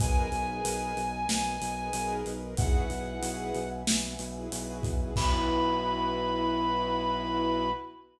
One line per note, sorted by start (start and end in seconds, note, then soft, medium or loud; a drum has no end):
0.00 0.28 B1 medium
0.00 0.26 D#4 loud
0.00 0.26 G#4 medium
0.00 0.26 A#4 medium
0.00 2.56 A#4 medium
0.00 0.26 B4 medium
0.00 2.56 B4 medium
0.00 2.56 D#5 loud
0.00 2.13 G#5 loud
0.00 2.56 G#5 medium
0.00 kick loud
0.00 closed hi-hat loud
0.32 0.60 B1 medium
0.32 0.45 D#4 medium
0.32 0.45 G#4 medium
0.32 0.45 A#4 medium
0.32 0.45 B4 medium
0.32 closed hi-hat medium
0.48 1.00 D#4 medium
0.48 1.00 G#4 medium
0.48 1.00 A#4 medium
0.48 1.00 B4 medium
0.65 0.92 B1 medium
0.65 closed hi-hat loud
0.97 1.24 B1 medium
0.97 closed hi-hat medium
1.29 1.56 B1 medium
1.29 snare loud
1.61 1.89 B1 medium
1.61 closed hi-hat loud
1.77 1.90 D#4 medium
1.77 1.90 G#4 medium
1.77 1.90 A#4 medium
1.77 1.90 B4 medium
1.93 2.21 B1 medium
1.93 2.32 D#4 medium
1.93 2.32 G#4 medium
1.93 2.32 A#4 medium
1.93 2.32 B4 medium
1.93 closed hi-hat loud
2.26 2.53 B1 medium
2.26 closed hi-hat medium
2.42 2.55 D#4 medium
2.42 2.55 G#4 medium
2.42 2.55 A#4 medium
2.42 2.55 B4 medium
2.57 2.86 B1 medium
2.57 2.84 E4 medium
2.57 2.84 F#4 medium
2.57 2.84 G#4 loud
2.57 2.84 B4 medium
2.57 5.14 B4 medium
2.57 5.14 E5 medium
2.57 3.68 F#5 medium
2.57 5.14 F#5 medium
2.57 5.14 G#5 medium
2.57 kick loud
2.57 closed hi-hat loud
2.90 3.18 B1 medium
2.90 3.03 E4 medium
2.90 3.03 F#4 medium
2.90 3.03 G#4 medium
2.90 3.03 B4 medium
2.90 closed hi-hat medium
3.06 3.58 E4 medium
3.06 3.58 F#4 medium
3.06 3.58 G#4 medium
3.06 3.58 B4 medium
3.22 3.50 B1 medium
3.22 closed hi-hat loud
3.55 3.83 B1 medium
3.55 closed hi-hat medium
3.87 4.15 B1 medium
3.87 snare loud
4.19 4.47 B1 medium
4.19 closed hi-hat loud
4.36 4.49 E4 medium
4.36 4.49 F#4 medium
4.36 4.49 G#4 medium
4.36 4.49 B4 medium
4.52 4.79 B1 medium
4.52 4.90 E4 medium
4.52 4.90 F#4 medium
4.52 4.90 G#4 medium
4.52 4.90 B4 medium
4.52 closed hi-hat loud
4.83 5.11 B1 medium
4.83 kick loud
4.83 closed hi-hat medium
5.00 5.13 E4 medium
5.00 5.13 F#4 medium
5.00 5.13 G#4 medium
5.00 5.13 B4 medium
5.16 7.69 B1 loud
5.16 7.69 B3 loud
5.16 7.69 E4 loud
5.16 7.69 F#4 loud
5.16 7.69 B4 loud
5.16 7.70 B5 loud
5.16 kick loud
5.16 crash loud